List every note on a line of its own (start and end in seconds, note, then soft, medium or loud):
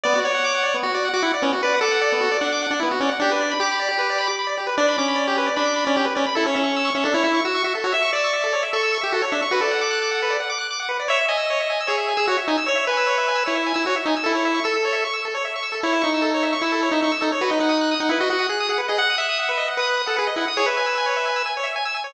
0.03 0.14 B3 loud
0.03 0.20 D5 loud
0.15 0.24 F#4 medium
0.22 0.77 C#5 medium
0.22 0.31 D5 medium
0.34 0.43 F#5 medium
0.44 0.53 D6 medium
0.55 0.63 F#5 medium
0.63 0.72 D5 medium
0.74 0.83 B3 medium
0.83 0.92 F#4 medium
0.83 1.09 F#4 medium
0.94 1.03 D5 medium
1.05 1.14 F#5 medium
1.13 1.23 F#4 medium
1.13 1.22 D6 medium
1.23 1.32 E4 medium
1.23 1.32 F#5 medium
1.34 1.43 D5 medium
1.42 1.51 B3 medium
1.42 1.52 C#4 medium
1.53 1.62 F#4 medium
1.63 1.80 B4 medium
1.63 1.73 D5 medium
1.74 1.83 F#5 medium
1.81 2.37 A4 medium
1.81 1.91 D6 medium
1.91 2.00 F#5 medium
2.01 2.10 D5 medium
2.12 2.21 B3 medium
2.20 2.29 F#4 medium
2.32 2.40 D5 medium
2.41 2.67 D4 medium
2.41 2.50 F#5 medium
2.52 2.61 D6 medium
2.62 2.71 F#5 medium
2.71 2.80 D4 medium
2.71 2.80 D5 medium
2.80 2.91 B3 medium
2.80 2.89 E4 medium
2.91 3.00 F#4 medium
3.00 3.10 C#4 medium
3.00 3.10 D5 medium
3.09 3.18 F#5 medium
3.20 3.54 D4 medium
3.20 3.30 G4 loud
3.31 3.40 B4 medium
3.41 3.49 D5 medium
3.51 3.60 B5 medium
3.60 4.28 G4 medium
3.60 3.70 D6 medium
3.71 3.80 B5 medium
3.79 3.88 D5 medium
3.89 3.98 G4 medium
3.98 4.07 B4 medium
4.10 4.19 D5 medium
4.18 4.27 B5 medium
4.27 4.36 D6 medium
4.39 4.48 B5 medium
4.47 4.56 D5 medium
4.57 4.66 G4 medium
4.67 4.76 B4 medium
4.78 4.97 D4 medium
4.78 4.86 D5 loud
4.88 4.97 B5 medium
4.98 5.49 C#4 medium
4.98 5.07 D6 medium
5.08 5.17 B5 medium
5.16 5.25 D5 medium
5.27 5.36 G4 loud
5.38 5.46 B4 medium
5.46 5.55 D5 medium
5.56 5.85 D4 medium
5.56 5.65 B5 medium
5.65 5.74 D6 medium
5.76 5.85 B5 medium
5.85 5.96 C#4 medium
5.85 5.94 D5 medium
5.96 6.06 C#4 medium
5.96 6.05 G4 medium
6.05 6.14 B4 medium
6.15 6.26 C#4 medium
6.15 6.24 D5 medium
6.26 6.35 B5 medium
6.35 6.46 E4 medium
6.35 6.44 A4 loud
6.46 6.55 C#4 medium
6.46 6.56 C#5 medium
6.54 6.90 C#4 medium
6.54 6.63 E5 medium
6.64 6.72 C#6 medium
6.76 6.85 E6 medium
6.85 6.94 C#6 medium
6.95 7.04 C#4 medium
6.95 7.04 E5 medium
7.04 7.14 D4 medium
7.04 7.13 A4 medium
7.14 7.23 E4 medium
7.14 7.23 C#5 medium
7.23 7.41 E4 medium
7.23 7.32 E5 medium
7.34 7.43 C#6 medium
7.45 7.63 F#4 medium
7.45 7.54 E6 medium
7.55 7.63 C#6 medium
7.64 7.74 F#4 medium
7.64 7.73 E5 medium
7.75 7.84 A4 medium
7.84 7.93 F#4 medium
7.84 7.93 C#5 medium
7.92 8.01 E5 medium
7.92 8.11 E5 medium
8.02 8.11 C#6 medium
8.13 8.63 D5 medium
8.13 8.24 E6 medium
8.24 8.33 C#6 medium
8.33 8.42 E5 medium
8.44 8.53 A4 medium
8.53 8.62 C#5 medium
8.63 8.72 E5 medium
8.73 8.98 A4 medium
8.73 8.82 C#6 medium
8.83 8.92 E6 medium
8.92 9.01 C#6 medium
9.01 9.13 G4 medium
9.01 9.10 E5 medium
9.12 9.22 F#4 medium
9.12 9.23 A4 loud
9.22 9.31 C#5 medium
9.32 9.41 D4 medium
9.32 9.41 E5 medium
9.42 9.51 C#6 medium
9.51 9.61 F#4 medium
9.51 9.61 B4 loud
9.61 10.37 A4 medium
9.61 9.71 D5 medium
9.71 9.80 F#5 medium
9.81 9.90 D6 medium
9.91 10.00 F#6 medium
10.02 10.11 D6 medium
10.11 10.20 F#5 medium
10.22 10.31 B4 medium
10.30 10.39 D5 medium
10.40 10.49 F#5 medium
10.50 10.58 D6 medium
10.58 10.67 F#6 medium
10.71 10.79 D6 medium
10.80 10.88 F#5 medium
10.89 10.98 B4 medium
11.00 11.08 D5 medium
11.08 11.17 C#5 loud
11.08 11.26 E5 medium
11.21 11.30 E5 medium
11.28 11.80 D#5 medium
11.28 11.37 G#5 medium
11.37 11.46 E6 medium
11.50 11.59 C#5 medium
11.60 11.69 E5 medium
11.70 11.79 G#5 medium
11.81 11.89 E6 medium
11.87 12.14 G#4 medium
11.87 11.96 C#5 medium
11.98 12.06 E5 medium
12.08 12.17 G#5 medium
12.17 12.26 G#4 medium
12.17 12.26 E6 medium
12.27 12.37 F#4 medium
12.27 12.38 C#5 medium
12.38 12.46 E5 medium
12.48 12.57 D#4 medium
12.48 12.57 G#5 medium
12.57 12.66 E6 medium
12.66 12.75 C#5 medium
12.66 12.85 C#5 medium
12.75 12.84 E5 medium
12.87 13.44 B4 medium
12.87 12.97 G#5 medium
12.97 13.06 E6 medium
13.07 13.16 C#5 medium
13.18 13.26 E5 medium
13.28 13.37 G#5 medium
13.35 13.44 E6 medium
13.46 13.73 E4 medium
13.46 13.55 C#5 medium
13.55 13.64 E5 medium
13.66 13.75 G#5 medium
13.74 13.85 E4 medium
13.74 13.83 E6 medium
13.86 13.95 F#4 medium
13.86 13.96 C#5 medium
13.96 14.05 E5 medium
14.05 14.15 D#4 medium
14.05 14.16 G#5 medium
14.16 14.25 E6 medium
14.24 14.60 E4 medium
14.24 14.32 A4 medium
14.35 14.43 C#5 medium
14.45 14.54 E5 medium
14.54 14.63 C#6 medium
14.64 15.04 A4 medium
14.64 14.73 E6 medium
14.74 14.83 A4 medium
14.85 14.94 C#5 medium
14.93 15.01 E5 medium
15.05 15.14 C#6 medium
15.13 15.22 E6 medium
15.25 15.34 A4 medium
15.35 15.43 C#5 medium
15.45 15.54 E5 medium
15.56 15.64 C#6 medium
15.63 15.72 E6 medium
15.72 15.81 A4 medium
15.83 16.02 E4 medium
15.83 15.93 C#5 medium
15.93 16.02 E5 medium
16.02 16.55 D#4 medium
16.02 16.10 C#6 medium
16.14 16.23 E6 medium
16.22 16.31 A4 medium
16.34 16.43 C#5 medium
16.43 16.52 E5 medium
16.53 16.62 C#6 medium
16.61 16.89 E4 medium
16.61 16.72 E6 medium
16.72 16.81 A4 medium
16.83 16.92 C#5 medium
16.91 17.01 D#4 medium
16.91 17.02 E5 medium
17.02 17.12 D#4 medium
17.02 17.13 C#6 medium
17.12 17.21 E6 medium
17.21 17.31 D#4 medium
17.21 17.30 A4 medium
17.32 17.41 C#5 medium
17.41 17.51 F#4 medium
17.41 17.50 B4 medium
17.50 17.60 D#4 medium
17.50 17.59 D#5 medium
17.60 17.95 D#4 medium
17.60 17.69 F#5 medium
17.69 17.78 D#6 medium
17.81 17.90 F#6 medium
17.91 18.00 D#6 medium
18.00 18.09 D#4 medium
18.00 18.09 F#5 medium
18.09 18.19 E4 medium
18.09 18.20 B4 medium
18.20 18.29 F#4 medium
18.20 18.29 D#5 medium
18.30 18.47 F#4 medium
18.30 18.40 F#5 medium
18.39 18.48 D#6 medium
18.49 18.67 G#4 medium
18.49 18.59 F#6 medium
18.60 18.69 D#6 medium
18.69 18.78 G#4 medium
18.69 18.79 F#5 medium
18.78 18.87 B4 medium
18.88 18.99 G#4 medium
18.88 18.97 D#5 medium
18.98 19.16 F#5 medium
18.98 19.08 F#5 medium
19.10 19.19 D#6 medium
19.18 19.69 E5 medium
19.18 19.27 F#6 medium
19.29 19.38 D#6 medium
19.39 19.48 F#5 medium
19.49 19.58 B4 medium
19.57 19.66 D#5 medium
19.68 19.77 F#5 medium
19.77 20.02 B4 medium
19.77 19.88 D#6 medium
19.87 19.96 F#6 medium
19.97 20.06 D#6 medium
20.06 20.17 A4 medium
20.06 20.15 F#5 medium
20.17 20.28 G#4 medium
20.17 20.25 B4 medium
20.27 20.36 D#5 medium
20.36 20.45 E4 medium
20.36 20.46 F#5 medium
20.48 20.57 D#6 medium
20.57 20.66 G#4 medium
20.57 20.66 C#5 loud
20.66 21.43 B4 medium
20.66 20.76 E5 medium
20.77 20.86 G#5 medium
20.86 20.95 E6 medium
20.98 21.06 G#5 medium
21.06 21.15 C#5 medium
21.16 21.25 E5 medium
21.25 21.34 G#5 medium
21.36 21.45 E6 medium
21.46 21.55 G#5 medium
21.57 21.66 C#5 medium
21.63 21.72 E5 medium
21.76 21.85 G#5 loud
21.85 21.94 E6 medium
21.94 22.03 G#5 medium
22.04 22.13 C#5 medium